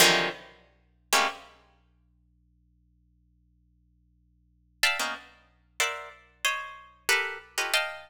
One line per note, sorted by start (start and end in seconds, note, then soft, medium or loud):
0.00 0.29 C3 loud
0.00 0.29 D3 loud
0.00 0.29 D#3 loud
0.00 0.29 E3 loud
0.00 0.29 F3 loud
0.00 0.29 F#3 loud
1.13 1.27 G3 medium
1.13 1.27 G#3 medium
1.13 1.27 A3 medium
1.13 1.27 A#3 medium
1.13 1.27 C4 medium
1.13 1.27 C#4 medium
4.83 4.98 D5 medium
4.83 4.98 E5 medium
4.83 4.98 F5 medium
4.83 4.98 G5 medium
4.83 4.98 A5 medium
4.99 5.14 A#3 soft
4.99 5.14 B3 soft
4.99 5.14 C#4 soft
4.99 5.14 D#4 soft
5.80 6.09 A#4 medium
5.80 6.09 C5 medium
5.80 6.09 D5 medium
5.80 6.09 E5 medium
5.80 6.09 F#5 medium
6.45 7.03 C5 medium
6.45 7.03 C#5 medium
6.45 7.03 D#5 medium
7.09 7.38 G4 medium
7.09 7.38 A4 medium
7.09 7.38 A#4 medium
7.09 7.38 B4 medium
7.58 7.72 F4 medium
7.58 7.72 G4 medium
7.58 7.72 A4 medium
7.58 7.72 B4 medium
7.58 7.72 C#5 medium
7.58 7.72 D#5 medium
7.74 8.10 D#5 medium
7.74 8.10 F5 medium
7.74 8.10 G5 medium
7.74 8.10 A5 medium